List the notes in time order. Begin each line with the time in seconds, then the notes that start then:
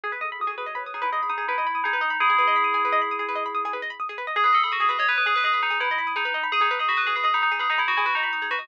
0.04 G#4
0.12 G#4 B4
0.21 A4 D#5
0.31 G#4 B5
0.40 F#4 D#6
0.47 G#4
0.58 G#4 B4
0.66 C#5 D#5
0.75 B4 B5
0.85 B4 D#6
0.94 D#4 G#4
1.02 E4 B4
1.12 G#4 D#5
1.23 B5
1.30 D#4 D#6
1.38 G#4
1.48 E4 B4
1.58 D#5
1.67 B5
1.75 D#6
1.84 D#4 G#4
1.93 B4
2.01 D#5
2.10 B5
2.20 E4 G#4 D#6
2.30 G#4
2.38 B4
2.48 D#5
2.56 B5
2.64 D#6
2.74 G#4
2.85 B4
2.92 D#5
3.02 B5
3.11 D#6
3.19 G#4
3.29 B4
3.35 D#5
3.46 B5
3.55 D#6
3.65 G#4
3.73 B4
3.82 D#5
3.90 B5
4.00 D#6
4.09 G#4
4.18 B4
4.27 D#5
4.36 G#4
4.44 G#4 B4
4.53 A4 D#5
4.64 G#4 B5
4.72 F#4 D#6
4.80 G#4
4.89 G#4 B4
4.99 C#5 D#5
5.09 B4 B5
5.18 B4 D#6
5.26 G#4
5.36 B4
5.44 G#4 D#5
5.53 B5
5.62 D#4 D#6
5.70 G#4
5.80 E4 B4
5.91 D#5
5.98 B5
6.07 D#6
6.16 D#4 G#4
6.25 B4
6.34 D#5
6.43 B5
6.52 G#4 D#6
6.61 D#4 G#4
6.71 B4
6.79 G#4 D#5
6.89 F#4 B5
6.97 B4 D#6
7.07 G#4
7.16 G#4 B4
7.24 G#4 D#5
7.34 D#4 B5
7.42 D#4 D#6
7.52 G#4
7.59 G#4 B4
7.70 D#4 D#5
7.78 E4 B5
7.88 F#4 D#6
7.97 E4 G#4
8.06 F#4 B4
8.15 D#4 D#5
8.23 B5
8.33 D#6
8.42 G#4
8.51 F#4 B4
8.59 D#5